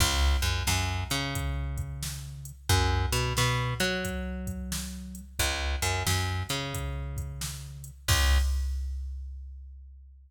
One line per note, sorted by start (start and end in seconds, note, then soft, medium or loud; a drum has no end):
0.00 0.37 C#2 loud
0.00 kick medium
0.00 crash medium
0.42 0.63 F#2 medium
0.42 closed hi-hat medium
0.67 1.04 F#2 loud
0.67 snare medium
1.10 2.52 C#3 loud
1.10 closed hi-hat medium
1.35 kick medium
1.35 closed hi-hat medium
1.78 kick medium
1.78 closed hi-hat medium
2.03 snare medium
2.45 closed hi-hat medium
2.69 3.06 F#2 loud
2.69 kick medium
2.69 closed hi-hat medium
3.12 3.33 B2 loud
3.12 closed hi-hat medium
3.37 3.74 B2 loud
3.37 snare medium
3.80 5.21 F#3 loud
3.80 closed hi-hat medium
4.05 kick medium
4.05 closed hi-hat medium
4.47 kick medium
4.47 closed hi-hat medium
4.72 snare medium
5.15 closed hi-hat medium
5.39 5.76 C#2 loud
5.39 kick medium
5.39 closed hi-hat medium
5.82 6.03 F#2 loud
5.82 closed hi-hat medium
6.06 6.43 F#2 medium
6.06 snare loud
6.49 7.91 C#3 medium
6.49 closed hi-hat medium
6.74 kick medium
6.74 closed hi-hat medium
7.17 kick medium
7.17 closed hi-hat medium
7.41 snare medium
7.84 closed hi-hat medium
8.08 8.38 C#2 loud
8.08 kick loud
8.08 crash loud